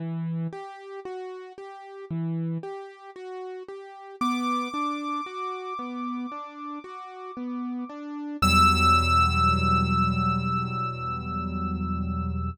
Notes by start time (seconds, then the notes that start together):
0.00 E3
0.53 G4
1.05 F#4
1.58 G4
2.11 E3
2.63 G4
3.16 F#4
3.68 G4
4.21 B3 D6
4.74 D4
5.26 F#4
5.79 B3
6.32 D4
6.84 F#4
7.37 B3
7.89 D4
8.42 E2 B2 F#3 G3 E6